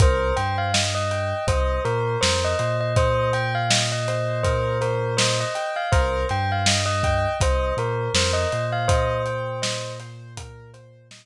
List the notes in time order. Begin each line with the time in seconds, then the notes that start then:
0.00 C2 A#4 C5, kick, closed hi-hat
0.36 G2 C5 G5, closed hi-hat
0.58 F5
0.74 D#5, snare
0.95 D#5
1.11 G5, closed hi-hat
1.47 C2 C5 D#5, kick, closed hi-hat
1.85 A#2 A#4 C5, closed hi-hat
2.21 F2 A#4 C5, snare
2.44 D#5
2.59 A#2 C5, closed hi-hat
2.81 D#5
2.96 C5 D#5, kick, closed hi-hat
3.33 G5, closed hi-hat
3.55 F5
3.70 D#5, snare
3.92 D#5
4.08 C5, closed hi-hat
4.43 A#4 C5, kick, closed hi-hat
4.81 A#4 C5, closed hi-hat
5.17 C5 D#5, snare
5.40 D#5
5.55 G5, closed hi-hat
5.76 F5
5.92 C2 A#4 C5, kick, closed hi-hat
6.29 G2 C5 G5, closed hi-hat
6.52 F5
6.66 D#5, snare
6.86 D#5
7.03 G5, kick, closed hi-hat
7.40 C2 C5 D#5, kick, closed hi-hat
7.77 A#2 A#4 C5, closed hi-hat
8.14 F2 A#4 C5, snare
8.33 D#5
8.52 A#2 C5, closed hi-hat
8.72 F5
8.88 C5 D#5, kick, closed hi-hat
9.26 G5, closed hi-hat
9.62 D#5, snare
10.00 C5, closed hi-hat
10.37 A#4, kick, closed hi-hat
10.74 C5, closed hi-hat
11.11 D#5, snare